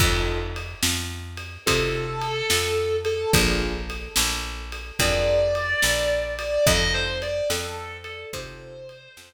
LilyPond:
<<
  \new Staff \with { instrumentName = "Distortion Guitar" } { \time 12/8 \key f \major \tempo 4. = 72 r2. a'2~ a'8 a'8 | r2. d''2~ d''8 d''8 | ees''8 c''8 d''8 a'4 a'8 c''2~ c''8 r8 | }
  \new Staff \with { instrumentName = "Acoustic Grand Piano" } { \time 12/8 \key f \major <c' ees' f' a'>2. <c' ees' f' a'>2. | <d' f' aes' bes'>2. <d' f' aes' bes'>2. | <c' ees' f' a'>2. <c' ees' f' a'>2. | }
  \new Staff \with { instrumentName = "Electric Bass (finger)" } { \clef bass \time 12/8 \key f \major f,4. f,4. c4. f,4. | bes,,4. bes,,4. f,4. bes,,4. | f,4. f,4. c4. f,4. | }
  \new DrumStaff \with { instrumentName = "Drums" } \drummode { \time 12/8 <cymc bd>4 cymr8 sn4 cymr8 <bd cymr>4 cymr8 sn4 cymr8 | <bd cymr>4 cymr8 sn4 cymr8 <bd cymr>4 cymr8 sn4 cymr8 | <bd cymr>4 cymr8 sn4 cymr8 <bd cymr>4 cymr8 sn4. | }
>>